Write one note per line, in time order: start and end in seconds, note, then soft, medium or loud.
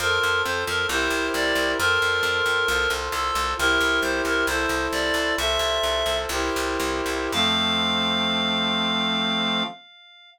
0.00 0.19 F2 loud
0.00 0.89 F4 medium
0.00 0.89 A4 medium
0.00 0.42 A#4 loud
0.00 0.89 C5 medium
0.23 0.42 F2 medium
0.45 0.65 F2 loud
0.45 0.64 C5 medium
0.67 0.86 F2 loud
0.67 0.86 A#4 medium
0.89 1.08 C2 loud
0.89 1.78 E4 medium
0.89 1.78 G4 medium
0.89 1.78 A#4 medium
0.89 1.78 C5 medium
0.89 1.27 C5 medium
1.10 1.29 C2 medium
1.34 1.53 C2 loud
1.34 1.71 D5 medium
1.55 1.74 C2 loud
1.79 1.99 F2 loud
1.79 2.68 F4 medium
1.79 2.68 A4 medium
1.79 2.92 A#4 loud
1.79 2.68 C5 medium
2.02 2.21 F2 medium
2.23 2.42 F2 loud
2.46 2.65 F2 medium
2.68 2.87 C2 loud
2.68 3.57 F4 medium
2.68 3.57 A4 medium
2.68 3.57 C5 medium
2.90 3.09 C2 loud
3.12 3.31 C2 loud
3.12 3.53 A4 medium
3.35 3.54 C2 loud
3.58 3.78 C2 loud
3.58 4.47 E4 medium
3.58 4.47 G4 medium
3.58 4.00 A#4 loud
3.58 4.47 A#4 medium
3.58 4.47 C5 medium
3.81 4.00 C2 loud
4.02 4.21 C2 loud
4.02 4.22 C5 medium
4.25 4.44 C2 medium
4.25 4.46 A#4 medium
4.47 4.66 C2 loud
4.47 5.36 E4 medium
4.47 5.36 A4 medium
4.47 5.36 C5 medium
4.47 4.86 C5 medium
4.69 4.88 C2 medium
4.92 5.12 C2 medium
4.92 5.34 D5 medium
5.14 5.33 C2 medium
5.37 5.58 C2 loud
5.37 6.30 F4 medium
5.37 6.30 A4 medium
5.37 6.30 C5 medium
5.37 6.18 E5 medium
5.59 5.79 C2 medium
5.83 6.03 C2 medium
6.06 6.26 C2 medium
6.29 6.50 C2 loud
6.29 7.32 E4 medium
6.29 7.32 G4 medium
6.29 7.32 A#4 medium
6.29 7.32 C5 medium
6.56 6.78 C2 loud
6.80 7.01 C2 loud
7.06 7.28 C2 loud
7.32 9.63 F2 loud
7.32 9.63 F3 loud
7.32 9.63 A3 loud
7.32 9.63 C4 loud
7.32 9.63 F5 loud